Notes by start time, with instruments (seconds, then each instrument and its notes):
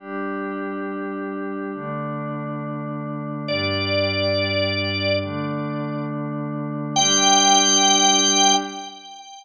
0.00 pad 5 (bowed) G3 D4 G4
1.74 pad 5 (bowed) D3 A3 D4
3.48 pad 5 (bowed) G2 G3 D4, drawbar organ D5
5.22 pad 5 (bowed) D3 A3 D4
6.96 pad 5 (bowed) G3 D4 G4, drawbar organ G5